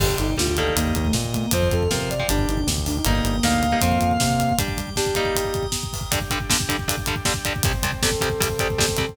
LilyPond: <<
  \new Staff \with { instrumentName = "Distortion Guitar" } { \time 4/4 \key g \minor \tempo 4 = 157 r1 | r1 | r4 f''2. | r1 |
\key g \major r1 | r1 | }
  \new Staff \with { instrumentName = "Ocarina" } { \time 4/4 \key g \minor g'8 ees'8 f'16 f'16 a'8 bes8 bes16 a16 r8 a16 bes16 | c''8 a'8 bes'16 bes'16 d''8 d'8 ees'16 d'16 r8 d'16 ees'16 | bes1 | g8 g8 g'2 r4 |
\key g \major r1 | r4 a'2. | }
  \new Staff \with { instrumentName = "Overdriven Guitar" } { \time 4/4 \key g \minor <d g>4 <d g>8 <ees g bes>2~ <ees g bes>8 | <f c'>4 <f c'>8. <f c'>16 <g d'>2 | <g bes ees'>4 <g bes ees'>8. <g bes ees'>16 <f c'>2 | <g d'>4 <g d'>8 <g bes ees'>2~ <g bes ees'>8 |
\key g \major <g, d g>8 <g, d g>8 <g, d g>8 <g, d g>8 <g, d g>8 <g, d g>8 <g, d g>8 <g, d g>8 | <c, c g>8 <c, c g>8 <c, c g>8 <c, c g>8 <c, c g>8 <c, c g>8 <c, c g>8 <c, c g>8 | }
  \new Staff \with { instrumentName = "Synth Bass 1" } { \clef bass \time 4/4 \key g \minor g,,8 g,,8 d,4 ees,8 ees,8 bes,4 | f,8 f,8 c4 g,,8 g,,8 d,4 | g,,8 g,,8 d,4 f,8 f,8 c4 | r1 |
\key g \major r1 | r1 | }
  \new Staff \with { instrumentName = "Drawbar Organ" } { \time 4/4 \key g \minor <d'' g''>2 <ees'' g'' bes''>2 | <f'' c'''>2 <g'' d'''>2 | <g'' bes'' ees'''>2 <f'' c'''>2 | <g'' d'''>2 <g'' bes'' ees'''>2 |
\key g \major <g d' g'>1 | <c g c'>1 | }
  \new DrumStaff \with { instrumentName = "Drums" } \drummode { \time 4/4 <cymc bd>16 bd16 <hh bd>16 bd16 <bd sn>16 bd16 <hh bd>16 bd16 <hh bd>16 bd16 <hh bd>16 bd16 <bd sn>16 bd16 <hh bd>16 bd16 | <hh bd>16 bd16 <hh bd>16 bd16 <bd sn>16 bd16 <hh bd>16 bd16 <hh bd>16 bd16 <hh bd>16 bd16 <bd sn>16 bd16 <hho bd>16 bd16 | <hh bd>16 bd16 <hh bd>16 bd16 <bd sn>16 bd16 <hh bd>16 bd16 <hh bd>16 bd16 <hh bd>16 bd16 <bd sn>16 bd16 <hh bd>16 bd16 | <hh bd>16 bd16 <hh bd>16 bd16 <bd sn>16 bd16 <hh bd>16 bd16 <hh bd>16 bd16 <hh bd>16 bd16 <bd sn>16 bd16 <hho bd>16 bd16 |
<hh bd>16 bd16 <hh bd>16 bd16 <bd sn>16 bd16 <hh bd>16 bd16 <hh bd>16 bd16 <hh bd>16 bd16 <bd sn>16 bd16 <hh bd>16 bd16 | <hh bd>16 bd16 <hh bd>16 bd16 <bd sn>16 bd16 <hh bd>16 bd16 <hh bd>16 bd16 <hh bd>16 bd16 <bd sn>16 bd16 <hh bd>16 bd16 | }
>>